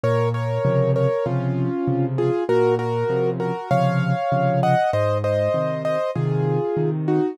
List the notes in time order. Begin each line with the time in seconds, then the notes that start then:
0.04 A#2 A#4 C#5
0.34 A#4 C#5
0.65 C3 C#3 F3
0.96 A#4 C#5
1.26 C3 C#3 F3 C#4 F4
1.88 C3 C#3 F3
2.18 F4 G#4
2.49 A#2 F#4 A#4
2.79 F#4 A#4
3.10 C3 C#3 F3
3.40 F#4 A#4
3.71 C3 C#3 F3 C#5 F5
4.32 C3 C#3 F3
4.63 D#5 F#5
4.93 G#2 C5 D#5
5.24 C5 D#5
5.54 C3 D#3
5.85 C5 D#5
6.15 C3 D#3 F4 G#4
6.77 C3 D#3
7.08 D#4 F#4